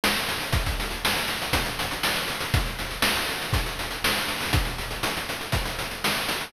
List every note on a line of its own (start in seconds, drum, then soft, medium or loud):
0.04 snare loud
0.15 closed hi-hat medium
0.29 closed hi-hat loud
0.41 closed hi-hat medium
0.53 kick loud
0.53 closed hi-hat loud
0.66 kick loud
0.66 closed hi-hat loud
0.80 closed hi-hat loud
0.91 closed hi-hat medium
1.05 snare loud
1.16 closed hi-hat medium
1.28 closed hi-hat loud
1.42 closed hi-hat medium
1.53 kick loud
1.53 closed hi-hat loud
1.66 closed hi-hat medium
1.79 closed hi-hat loud
1.91 closed hi-hat medium
2.03 snare loud
2.16 closed hi-hat medium
2.28 closed hi-hat medium
2.41 closed hi-hat medium
2.54 kick loud
2.54 closed hi-hat loud
2.66 closed hi-hat medium
2.79 closed hi-hat medium
2.91 closed hi-hat medium
3.02 snare loud
3.16 closed hi-hat medium
3.29 closed hi-hat medium
3.41 closed hi-hat medium
3.53 kick loud
3.53 closed hi-hat loud
3.66 closed hi-hat medium
3.79 closed hi-hat medium
3.91 closed hi-hat medium
4.04 snare loud
4.17 closed hi-hat medium
4.28 closed hi-hat medium
4.40 open hi-hat medium
4.53 kick loud
4.53 closed hi-hat loud
4.65 closed hi-hat medium
4.78 closed hi-hat medium
4.91 closed hi-hat medium
5.03 closed hi-hat loud
5.17 closed hi-hat medium
5.29 closed hi-hat medium
5.41 closed hi-hat medium
5.52 kick loud
5.52 closed hi-hat loud
5.66 closed hi-hat medium
5.79 closed hi-hat medium
5.91 closed hi-hat medium
6.04 snare loud
6.16 closed hi-hat medium
6.29 closed hi-hat loud
6.41 open hi-hat medium